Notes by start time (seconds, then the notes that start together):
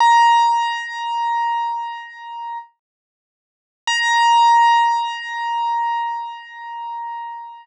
0.00 A#5
3.87 A#5